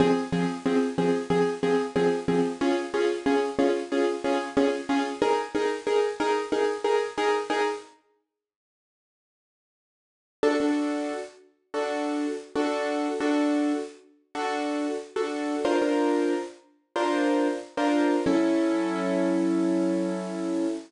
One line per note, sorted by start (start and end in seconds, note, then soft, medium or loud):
0.00 0.13 F3 medium
0.00 0.13 C4 loud
0.00 0.13 G#4 loud
0.32 0.46 F3 loud
0.32 0.46 C4 medium
0.32 0.46 G#4 medium
0.66 0.79 F3 medium
0.66 0.79 C4 loud
0.66 0.79 G#4 medium
0.98 1.11 F3 medium
0.98 1.11 C4 medium
0.98 1.11 G#4 medium
1.30 1.43 F3 medium
1.30 1.43 C4 medium
1.30 1.43 G#4 loud
1.63 1.76 F3 medium
1.63 1.76 C4 medium
1.63 1.76 G#4 medium
1.96 2.09 F3 loud
1.96 2.09 C4 medium
1.96 2.09 G#4 medium
2.28 2.41 F3 loud
2.28 2.41 C4 medium
2.28 2.41 G#4 medium
2.61 2.74 C#4 loud
2.61 2.74 F4 loud
2.61 2.74 G#4 medium
2.94 3.07 C#4 medium
2.94 3.07 F4 medium
2.94 3.07 G#4 medium
3.26 3.39 C#4 medium
3.26 3.39 F4 medium
3.26 3.39 G#4 medium
3.59 3.72 C#4 loud
3.59 3.72 F4 medium
3.59 3.72 G#4 medium
3.92 4.05 C#4 medium
3.92 4.05 F4 medium
3.92 4.05 G#4 medium
4.24 4.37 C#4 medium
4.24 4.37 F4 medium
4.24 4.37 G#4 medium
4.57 4.70 C#4 loud
4.57 4.70 F4 medium
4.57 4.70 G#4 medium
4.89 5.02 C#4 medium
4.89 5.02 F4 medium
4.89 5.02 G#4 medium
5.22 5.35 D#4 medium
5.22 5.35 G#4 loud
5.22 5.35 A#4 loud
5.55 5.68 D#4 loud
5.55 5.68 G#4 medium
5.55 5.68 A#4 medium
5.87 6.00 D#4 medium
5.87 6.00 G#4 medium
5.87 6.00 A#4 medium
6.20 6.33 D#4 medium
6.20 6.33 G#4 medium
6.20 6.33 A#4 medium
6.52 6.65 D#4 medium
6.52 6.65 G#4 medium
6.52 6.65 A#4 medium
6.84 6.97 D#4 medium
6.84 6.97 G#4 loud
6.84 6.97 A#4 medium
7.18 7.31 D#4 medium
7.18 7.31 G#4 medium
7.18 7.31 A#4 medium
7.50 7.63 D#4 medium
7.50 7.63 G#4 medium
7.50 7.63 A#4 medium
10.43 10.56 D4 medium
10.43 10.56 F#4 medium
10.43 10.56 A4 medium
10.60 11.12 D4 medium
10.60 11.12 F#4 medium
10.60 11.12 A4 medium
11.74 12.26 D4 medium
11.74 12.26 F#4 medium
11.74 12.26 A4 medium
12.55 13.08 D4 medium
12.55 13.08 F#4 medium
12.55 13.08 A4 medium
13.20 13.73 D4 medium
13.20 13.73 F#4 medium
13.20 13.73 A4 medium
14.35 14.87 D4 medium
14.35 14.87 F#4 medium
14.35 14.87 A4 medium
15.16 15.55 D4 medium
15.16 15.55 F#4 medium
15.16 15.55 A4 medium
15.65 15.78 D4 medium
15.65 15.78 F4 medium
15.65 15.78 A#4 medium
15.65 15.78 C5 medium
15.82 16.34 D4 medium
15.82 16.34 F4 medium
15.82 16.34 A#4 medium
15.82 16.34 C5 medium
16.96 17.48 D4 medium
16.96 17.48 F4 medium
16.96 17.48 A#4 medium
16.96 17.48 C5 medium
17.77 18.16 D4 medium
17.77 18.16 F4 medium
17.77 18.16 A#4 medium
17.77 18.16 C5 medium
18.26 20.67 F#3 medium
18.26 20.67 C#4 loud
18.26 20.67 E4 medium
18.26 20.67 A4 medium